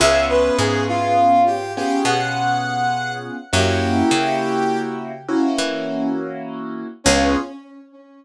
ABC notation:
X:1
M:12/8
L:1/8
Q:3/8=68
K:Db
V:1 name="Brass Section"
=e _c A F2 =G G _g4 z | =G5 z7 | D3 z9 |]
V:2 name="Acoustic Grand Piano"
[_CDFA]6 [CDFA]6 | [B,D_FG]6 [B,DFG]6 | [_CDFA]3 z9 |]
V:3 name="Electric Bass (finger)" clef=bass
D,,2 A,,5 _C,5 | G,,2 D,5 _F,5 | D,,3 z9 |]